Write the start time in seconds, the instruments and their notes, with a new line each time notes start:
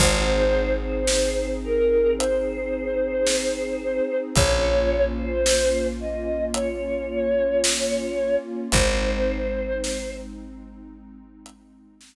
0.00 electric bass (finger) G#1, pad 2 (warm) C4 D#4 G#4, choir aahs C5, kick, crash
0.82 choir aahs C5
1.07 snare
1.64 choir aahs A#4
2.18 choir aahs C5, closed hi-hat
3.27 snare
4.35 electric bass (finger) A#1, pad 2 (warm) A#3 C#4 F4, choir aahs C#5, kick, closed hi-hat
5.17 choir aahs C5
5.46 snare
6.00 choir aahs D#5
6.54 choir aahs C#5, closed hi-hat
7.64 snare
8.72 electric bass (finger) G#1, pad 2 (warm) G#3 C4 D#4, choir aahs C5, kick, closed hi-hat
9.84 snare
11.46 closed hi-hat
12.01 snare